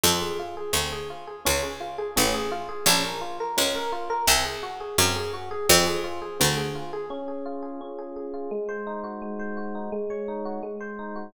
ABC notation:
X:1
M:2/2
L:1/8
Q:1/2=85
K:Db
V:1 name="Electric Piano 1"
C A F A C A F A | D A F A D A F A | D B F B D B F B | C A G A C A G A |
C A F A C A F A | D A F A D A A F | A, c E G A, c G E | A, d E G A, c E G |]
V:2 name="Harpsichord" clef=bass
F,,4 =D,,4 | D,,4 =A,,,4 | B,,,4 D,,4 | C,,4 G,,4 |
F,,4 =D,,4 | z8 | z8 | z8 |]